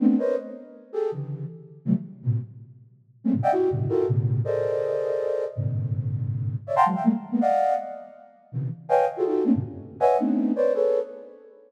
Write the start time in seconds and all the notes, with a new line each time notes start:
0.00 A3 B3 C4 D4
0.18 A#4 B4 C5 C#5 D#5
0.93 G4 G#4 A4
1.11 C#3 D3 E3
1.85 C3 D3 E3 F#3 G3 A3
2.22 A2 A#2 B2 C3
3.24 G3 G#3 A3 A#3 C4 C#4
3.33 G#2 A2 B2 C#3
3.43 D5 D#5 E5 F#5 G5
3.52 E4 F#4 G4
3.70 F#2 G2 A2 B2 C#3 D3
3.89 E4 F4 F#4 G4 A4 A#4
4.07 A2 B2 C#3
4.44 G#4 A4 A#4 C5 D5 D#5
5.56 G2 G#2 A#2 C3 D3
6.67 C#5 D5 E5
6.76 F5 F#5 G5 A5 A#5 C6
6.85 E3 F#3 G#3
6.95 E5 F5 G5
7.04 G3 G#3 A3 A#3
7.31 G#3 A#3 B3
7.41 D5 D#5 F5 F#5
8.52 B2 C3 C#3 D#3 E3
8.89 B4 C#5 D#5 F5 G5 G#5
9.17 F4 F#4 G#4 A4
9.26 D#4 F4 F#4 G4 A4
9.44 A3 A#3 C4 C#4 D4
9.54 F#2 G2 A2 A#2 C3 D3
10.00 B4 C#5 D#5 E5 F#5 G#5
10.18 A3 B3 C4 D4 D#4
10.56 B4 C5 C#5 D5
10.74 G#4 A4 B4 C#5